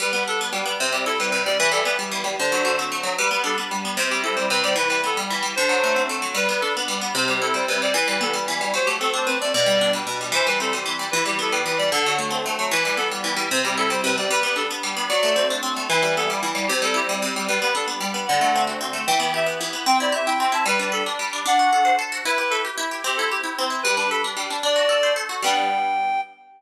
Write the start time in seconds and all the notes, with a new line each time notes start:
0.00 G3 B4
0.13 B3 B4
0.28 D4 A4
0.41 B3
0.53 G3
0.66 B3
0.80 C3 C5
0.92 G3 G4
1.06 E4 A4
1.19 G3 B4
1.31 C3 B4
1.46 G3 D5
1.59 E3 B4
1.72 G3 A4
1.85 B3 B4
1.99 G3
2.12 E3
2.24 G3
2.39 D3 C5
2.52 F#3
2.65 A3
2.79 C4
2.92 A3
3.03 F#3
3.18 G3 B4
3.31 B3 B4
3.44 D4 A4
3.58 B3
3.71 G3
3.85 B3
3.97 C3 C5
4.09 G3 G4
4.24 E4 A4
4.35 G3 C5
4.50 C3 B4
4.63 G3 D5
4.76 E3 B4
4.89 G3 B4
5.04 B3 A4
5.17 G3
5.30 E3
5.43 G3
5.56 D3 C5
5.69 F#3
5.84 A3
5.96 C4
6.09 A3
6.22 F#3
6.34 G3 B4
6.49 B3 B4
6.61 D4 A4
6.77 B3
6.88 G3
7.01 B3
7.15 C3 C5
7.28 G3 G4
7.42 E4 A4
7.54 G3 C5
7.68 C3 B4
7.82 G3 D5
7.94 E3 B4
8.08 G3 B4
8.21 B3 A4
8.33 G3
8.48 E3
8.61 G3
8.74 F#3 C5
8.85 A3 G4
9.00 C4 A4
9.14 D4 C5
9.26 C4 B4
9.41 A3 D5
9.53 B2 D5
9.66 G3
9.81 D4
9.93 G3
10.07 B2
10.21 G3
10.32 E3 C5
10.46 G3 B4
10.60 C4 A4
10.73 G3
10.86 E3
10.99 G3
11.11 E3 B4
11.26 G3 G4
11.39 B3 A4
11.51 G3 B4
11.66 E3 B4
11.78 G3 D5
11.92 D3 A4
12.06 F#3
12.18 A3
12.31 C4
12.46 A3
12.59 F#3
12.71 E3 B4
12.84 G3 B4
12.97 B3 A4
13.11 G3
13.24 E3
13.37 G3
13.51 C3 C5
13.65 G3 G4
13.77 E4 A4
13.90 G3 C5
14.04 C3 B4
14.18 G3 D5
14.31 G3 B4
14.43 B3 B4
14.56 D4 A4
14.71 B3
14.83 G3
14.97 B3
15.09 F#3 D5
15.23 A3
15.36 C4
15.50 D4
15.63 C4
15.76 A3
15.89 E3 B4
16.02 G3 B4
16.17 B3 A4
16.30 G3
16.43 E3
16.55 G3
16.67 C3 G4
16.82 G3 A4
16.94 E4 G4
17.09 G3
17.22 C3
17.36 G3
17.48 G3 B4
17.62 B3 B4
17.75 D4 A4
17.88 B3
18.00 G3
18.14 B3
18.27 D3 F#5
18.41 A3
18.56 C4
18.67 F#4
18.81 C4
18.93 A3
19.07 E3 G5
19.20 B3 G5
19.34 G4 E5
19.46 B3
19.61 E3
19.73 B3
19.86 C4 G5
20.00 E4 D5
20.12 G4 E5
20.26 E4 G5
20.40 C4 G5
20.52 E4 A5
20.66 G3 B4
20.79 D4 B4
20.92 A4 B4
21.06 D4
21.19 G3
21.33 D4
21.46 D4 F#5
21.59 F#4
21.73 A4
21.85 C5
21.99 A4
22.12 F#4
22.25 E4 B4
22.38 G4 B4
22.50 A4 B4
22.65 G4
22.78 E4
22.91 G4
23.04 C4 G4
23.16 E4 A4
23.31 G4
23.43 E4
23.59 C4
23.70 E4
23.83 G3 B4
23.97 D4 B4
24.10 A4 B4
24.24 D4
24.37 G3
24.50 D4
24.63 D4 D5
24.76 F#4
24.89 A4
25.03 C5
25.16 A4
25.29 F#4
25.42 G3 B3 D4 G5